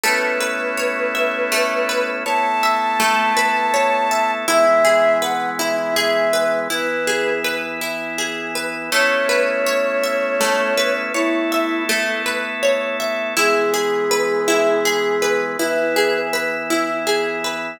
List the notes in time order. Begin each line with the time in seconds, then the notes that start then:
0.04 A3 B3 C#4 E4 B4
0.41 B4
0.77 C#5
1.15 E5
1.52 A3
1.89 B4
2.25 A3 B3 E4 A4 C#5 A5
2.63 E5
3.00 A3
3.37 B4
3.74 C#5
4.11 E5
4.48 E3 G#3 B3 E4 E5
4.85 G#4
5.20 B4 F#5
5.59 E4 E5
5.96 G#4 E5
6.33 B4
6.70 E3 B3 E4 B4
7.07 G#4
7.44 B4
7.81 E4
8.18 G#4
8.55 B4
8.91 A3 B3 C#4 E4 C#5
9.29 B4
9.67 C#5
10.04 E5
10.41 A3
10.77 B4
11.14 A3 B3 E4 A4 C#5
11.52 E5
11.89 A3
12.26 B4
12.63 C#5
13.00 E5
13.37 E3 G#3 B3 E4 G#4
13.74 G#4
14.11 B4
14.48 E4
14.85 G#4
15.22 B4
15.58 E3 B3 E4 B4
15.96 G#4
16.33 B4
16.70 E4
17.07 G#4
17.44 B4